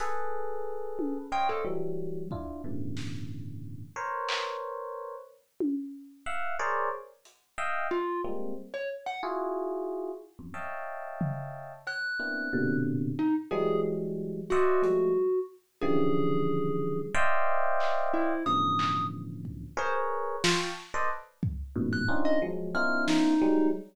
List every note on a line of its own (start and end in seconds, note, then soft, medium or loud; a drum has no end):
0.00 1.18 G#4 loud
0.00 1.18 A4 loud
0.00 1.18 B4 loud
0.00 closed hi-hat medium
0.99 high tom medium
1.32 1.62 C5 medium
1.32 1.62 C#5 medium
1.32 1.62 D#5 medium
1.32 1.62 F5 medium
1.32 1.47 G5 loud
1.49 1.64 A4 medium
1.65 2.24 E3 medium
1.65 2.24 F#3 medium
1.65 2.24 G3 medium
2.31 2.61 D4 soft
2.31 2.61 E4 soft
2.31 2.61 F4 soft
2.31 kick medium
2.64 3.83 G2 medium
2.64 3.83 A2 medium
2.64 3.83 B2 medium
2.64 3.83 C#3 medium
2.64 3.83 D3 medium
2.64 3.83 E3 medium
2.97 snare medium
3.96 5.15 A#4 medium
3.96 5.15 B4 medium
3.96 5.15 C5 medium
3.96 5.15 C#5 medium
4.29 clap loud
5.60 high tom medium
6.26 6.56 E5 medium
6.26 6.56 F5 medium
6.26 6.56 F#5 medium
6.59 6.89 G#4 loud
6.59 6.89 A#4 loud
6.59 6.89 C5 loud
6.59 6.89 C#5 loud
6.59 6.89 D5 loud
7.25 closed hi-hat medium
7.58 7.88 D#5 medium
7.58 7.88 E5 medium
7.58 7.88 F5 medium
7.58 7.88 G5 medium
7.91 8.21 F4 loud
8.24 8.54 G3 medium
8.24 8.54 G#3 medium
8.24 8.54 A#3 medium
8.24 8.54 C4 medium
8.74 8.89 C#5 medium
9.06 9.21 F#5 medium
9.23 10.12 E4 medium
9.23 10.12 F4 medium
9.23 10.12 F#4 medium
9.23 10.12 G#4 medium
10.39 10.54 E2 medium
10.39 10.54 F2 medium
10.39 10.54 F#2 medium
10.54 11.73 C#5 medium
10.54 11.73 D#5 medium
10.54 11.73 E5 medium
10.54 11.73 F5 medium
10.54 11.73 G5 medium
10.54 11.73 A5 medium
11.21 floor tom medium
11.87 12.76 F#6 medium
11.87 cowbell medium
12.20 12.49 A#3 medium
12.20 12.49 B3 medium
12.20 12.49 C4 medium
12.20 12.49 D4 medium
12.20 12.49 E4 medium
12.53 13.12 A#2 loud
12.53 13.12 B2 loud
12.53 13.12 C3 loud
12.53 13.12 D3 loud
13.19 13.34 D#4 medium
13.51 14.41 E3 loud
13.51 14.41 F#3 loud
13.51 14.41 G3 loud
13.51 14.41 G#3 loud
13.51 13.81 G#4 medium
14.50 15.39 F#4 medium
14.50 14.82 C5 medium
14.50 14.82 D5 medium
14.50 14.82 D#5 medium
14.50 14.82 E5 medium
14.50 14.82 F#5 medium
14.50 closed hi-hat medium
14.82 15.12 F3 medium
14.82 15.12 G3 medium
14.82 15.12 G#3 medium
14.82 15.12 A3 medium
14.82 closed hi-hat medium
15.81 17.01 C#3 loud
15.81 17.01 D3 loud
15.81 17.01 E3 loud
15.81 17.01 F3 loud
15.81 17.01 G3 loud
15.81 17.00 G#4 loud
17.14 18.33 C5 loud
17.14 18.33 D5 loud
17.14 18.33 D#5 loud
17.14 18.33 E5 loud
17.14 18.33 F5 loud
17.14 18.33 G5 loud
17.80 clap medium
18.13 18.43 E4 medium
18.46 19.65 A2 medium
18.46 19.65 B2 medium
18.46 19.65 C#3 medium
18.46 19.65 D3 medium
18.46 19.65 E3 medium
18.46 19.65 F3 medium
18.46 19.05 D#6 medium
18.79 clap medium
19.45 kick medium
19.77 20.36 G#4 loud
19.77 20.36 A#4 loud
19.77 20.36 B4 loud
19.77 19.94 C5 medium
19.77 20.36 C#5 loud
20.44 20.59 F4 medium
20.44 20.73 F5 soft
20.44 20.73 G5 soft
20.44 20.73 A5 soft
20.44 20.73 B5 soft
20.44 20.73 C#6 soft
20.44 snare loud
20.94 21.09 A4 medium
20.94 21.09 B4 medium
20.94 21.09 C5 medium
20.94 21.09 D5 medium
20.94 21.09 D#5 medium
21.43 kick medium
21.76 22.05 E2 loud
21.76 22.05 F#2 loud
21.76 22.05 G#2 loud
21.76 22.05 A2 loud
21.76 22.05 A#2 loud
21.76 22.05 B2 loud
21.93 22.08 F#6 medium
22.08 22.38 C4 medium
22.08 22.38 C#4 medium
22.08 22.38 D4 medium
22.08 22.38 D#4 medium
22.08 22.38 F4 medium
22.25 22.40 D#5 loud
22.42 22.72 F3 medium
22.42 22.72 F#3 medium
22.42 22.72 G#3 medium
22.75 23.34 B3 medium
22.75 23.34 C#4 medium
22.75 23.34 D#4 medium
22.75 23.34 E4 medium
22.75 23.34 F4 medium
22.75 23.04 F6 medium
23.08 23.67 D#4 loud
23.08 snare medium
23.42 23.71 F#3 loud
23.42 23.71 G3 loud
23.42 23.71 G#3 loud